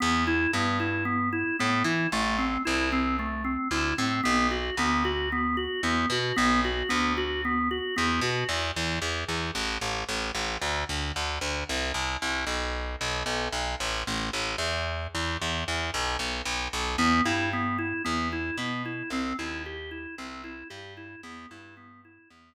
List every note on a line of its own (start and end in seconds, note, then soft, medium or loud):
0.00 0.47 E2 loud
0.00 0.24 B3 medium
0.27 0.51 E4 medium
0.53 1.44 G2 medium
0.53 0.78 B3 medium
0.80 1.04 E4 medium
1.05 1.29 B3 medium
1.33 1.56 E4 medium
1.59 1.83 A2 medium
1.59 1.83 B3 medium
1.84 2.07 E3 medium
1.84 2.09 E4 medium
2.12 2.57 A1 loud
2.12 2.37 A3 medium
2.38 2.62 C4 medium
2.65 3.57 C2 medium
2.65 2.89 E4 medium
2.92 3.16 C4 medium
3.19 3.43 A3 medium
3.44 3.68 C4 medium
3.71 3.93 D2 medium
3.71 3.95 E4 medium
3.98 4.21 A2 medium
3.98 4.22 C4 medium
4.23 4.70 B1 loud
4.23 4.47 B3 medium
4.51 4.75 F#4 medium
4.77 5.68 D2 medium
4.77 5.03 B3 medium
5.05 5.29 F#4 medium
5.32 5.56 B3 medium
5.57 5.81 F#4 medium
5.83 6.06 E2 medium
5.83 6.08 B3 medium
6.10 6.32 B2 loud
6.10 6.36 F#4 medium
6.36 6.83 B1 loud
6.36 6.60 B3 medium
6.64 6.88 F#4 medium
6.89 7.80 D2 medium
6.89 7.13 B3 medium
7.17 7.41 F#4 medium
7.45 7.69 B3 medium
7.71 7.95 F#4 medium
7.96 8.20 E2 medium
7.96 8.20 B3 medium
8.21 8.44 B2 medium
8.21 8.47 F#4 medium
8.49 8.71 E2 loud
8.76 8.99 E2 loud
9.02 9.24 E2 medium
9.29 9.51 E2 medium
9.55 9.78 A1 loud
9.81 10.04 A1 medium
10.09 10.31 A1 medium
10.35 10.57 A1 medium
10.62 10.84 D2 loud
10.89 11.12 D2 medium
11.16 11.39 D2 medium
11.41 11.64 D2 medium
11.69 11.92 C2 loud
11.94 12.17 C2 medium
12.22 12.45 C2 medium
12.47 12.96 B1 medium
13.01 13.23 B1 medium
13.26 13.48 B1 medium
13.53 13.75 B1 medium
13.80 14.03 A1 loud
14.07 14.30 A1 loud
14.33 14.56 A1 medium
14.58 15.07 E2 loud
15.15 15.37 E2 medium
15.42 15.64 E2 medium
15.68 15.90 E2 medium
15.94 16.16 B1 loud
16.19 16.42 B1 medium
16.45 16.68 B1 medium
16.73 16.96 B1 loud
16.98 17.21 E2 loud
16.98 17.22 B3 loud
17.25 17.93 G2 loud
17.25 17.49 E4 medium
17.53 17.77 B3 medium
17.78 18.02 E4 medium
18.05 18.51 E2 loud
18.05 18.28 B3 medium
18.33 18.56 E4 medium
18.58 19.03 B2 medium
18.58 18.82 B3 medium
18.85 19.09 E4 medium
19.10 19.33 C2 loud
19.10 19.36 C4 medium
19.39 20.07 D#2 medium
19.39 19.62 E4 medium
19.66 19.90 G4 medium
19.91 20.15 E4 medium
20.18 20.63 C2 medium
20.18 20.42 C4 medium
20.44 20.68 E4 medium
20.70 21.16 G2 loud
20.70 20.94 G4 medium
20.97 21.21 E4 medium
21.23 21.46 E2 loud
21.23 21.47 B3 medium
21.51 22.19 G2 medium
21.51 21.75 E4 medium
21.77 22.01 B3 medium
22.05 22.29 E4 medium
22.30 22.54 E2 medium
22.30 22.54 B3 medium